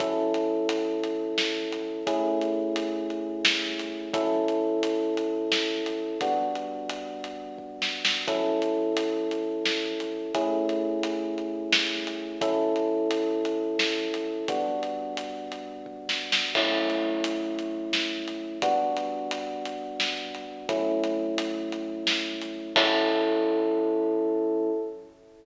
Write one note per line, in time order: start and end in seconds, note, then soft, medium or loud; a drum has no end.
0.00 2.03 F#3 medium
0.00 2.03 C#4 medium
0.00 2.03 E4 medium
0.00 2.03 A4 medium
0.00 kick loud
0.00 closed hi-hat medium
0.34 closed hi-hat medium
0.69 closed hi-hat loud
1.04 closed hi-hat medium
1.38 snare medium
1.72 closed hi-hat medium
2.07 4.10 A3 medium
2.07 4.10 C#4 medium
2.07 4.10 E4 medium
2.07 4.10 G#4 medium
2.07 kick medium
2.07 closed hi-hat medium
2.41 closed hi-hat medium
2.76 closed hi-hat medium
3.10 closed hi-hat soft
3.45 snare loud
3.79 closed hi-hat medium
4.14 6.17 F#3 medium
4.14 6.17 C#4 medium
4.14 6.17 E4 medium
4.14 6.17 A4 medium
4.14 kick loud
4.14 closed hi-hat medium
4.48 closed hi-hat medium
4.83 closed hi-hat medium
5.17 closed hi-hat medium
5.52 snare medium
5.86 closed hi-hat medium
6.21 8.23 G3 medium
6.21 8.23 B3 medium
6.21 8.23 D4 medium
6.21 8.23 F#4 medium
6.21 kick medium
6.21 closed hi-hat medium
6.55 closed hi-hat medium
6.89 closed hi-hat medium
7.24 closed hi-hat medium
7.58 kick medium
7.82 snare medium
8.05 snare loud
8.28 10.30 F#3 medium
8.28 10.30 C#4 medium
8.28 10.30 E4 medium
8.28 10.30 A4 medium
8.28 kick loud
8.28 closed hi-hat medium
8.62 closed hi-hat medium
8.97 closed hi-hat loud
9.31 closed hi-hat medium
9.65 snare medium
10.00 closed hi-hat medium
10.34 12.37 A3 medium
10.34 12.37 C#4 medium
10.34 12.37 E4 medium
10.34 12.37 G#4 medium
10.34 kick medium
10.34 closed hi-hat medium
10.69 closed hi-hat medium
11.03 closed hi-hat medium
11.38 closed hi-hat soft
11.73 snare loud
12.07 closed hi-hat medium
12.41 14.44 F#3 medium
12.41 14.44 C#4 medium
12.41 14.44 E4 medium
12.41 14.44 A4 medium
12.41 kick loud
12.41 closed hi-hat medium
12.76 closed hi-hat medium
13.11 closed hi-hat medium
13.45 closed hi-hat medium
13.79 snare medium
14.14 closed hi-hat medium
14.48 16.51 G3 medium
14.48 16.51 B3 medium
14.48 16.51 D4 medium
14.48 16.51 F#4 medium
14.48 kick medium
14.48 closed hi-hat medium
14.83 closed hi-hat medium
15.17 closed hi-hat medium
15.52 closed hi-hat medium
15.86 kick medium
16.09 snare medium
16.32 snare loud
16.55 18.58 F#3 medium
16.55 18.58 A3 medium
16.55 18.58 C#4 medium
16.55 18.58 E4 medium
16.55 kick medium
16.55 crash medium
16.90 closed hi-hat medium
17.24 closed hi-hat loud
17.59 closed hi-hat medium
17.93 snare medium
18.28 closed hi-hat medium
18.62 20.65 G3 medium
18.62 20.65 B3 medium
18.62 20.65 D4 medium
18.62 20.65 F#4 medium
18.62 kick loud
18.62 closed hi-hat loud
18.97 closed hi-hat medium
19.31 closed hi-hat medium
19.65 closed hi-hat medium
20.00 snare medium
20.35 closed hi-hat medium
20.69 22.72 F#3 medium
20.69 22.72 A3 medium
20.69 22.72 C#4 medium
20.69 22.72 E4 medium
20.69 kick loud
20.69 closed hi-hat medium
21.04 closed hi-hat medium
21.38 closed hi-hat loud
21.72 closed hi-hat medium
22.07 snare loud
22.41 closed hi-hat medium
22.76 24.70 F#3 loud
22.76 24.70 C#4 medium
22.76 24.70 E4 loud
22.76 24.70 A4 loud
22.76 kick loud
22.76 crash loud